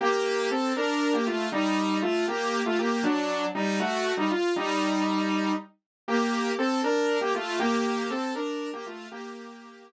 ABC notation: X:1
M:6/8
L:1/16
Q:3/8=79
K:Gm
V:1 name="Lead 2 (sawtooth)"
[B,G]4 [CA]2 [DB]3 [B,G] [A,F]2 | [G,E]4 [A,F]2 [B,G]3 [A,F] [B,G]2 | [^F,D]4 [G,E]2 [A,^F]3 [G,E] =F2 | [G,E]8 z4 |
[B,G]4 [CA]2 [DB]3 [B,G] [A,F]2 | [B,G]4 [CA]2 [DB]3 [B,G] [A,F]2 | [B,G]6 z6 |]